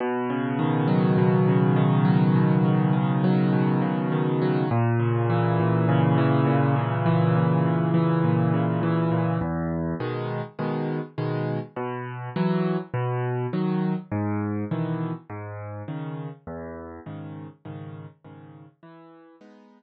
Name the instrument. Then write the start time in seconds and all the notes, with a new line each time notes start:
acoustic grand piano
0.00 B2
0.30 C#3
0.59 D#3
0.88 F#3
1.18 B2
1.48 C#3
1.76 D#3
2.05 F#3
2.36 B2
2.65 C#3
2.93 D#3
3.24 F#3
3.53 B2
3.82 C#3
4.12 D#3
4.42 F#3
4.71 A#2
5.00 C#3
5.30 E3
5.60 A#2
5.89 C#3
6.18 E3
6.47 A#2
6.76 C#3
7.06 E3
7.35 A#2
7.66 C#3
7.94 E3
8.24 A#2
8.54 C#3
8.83 E3
9.12 A#2
9.41 E2
10.00 B2 D#3 G#3
10.59 B2 D#3 G#3
11.18 B2 D#3 G#3
11.76 B2
12.36 E3 F#3
12.94 B2
13.53 D#3 F#3
14.12 G#2
14.71 B2 D#3 E3
15.30 G#2
15.88 C#3 D#3
16.47 E2
17.06 G#2 C#3 D#3
17.65 G#2 C#3 D#3
18.25 G#2 C#3 D#3
18.83 E3
19.41 G#3 B3 D#4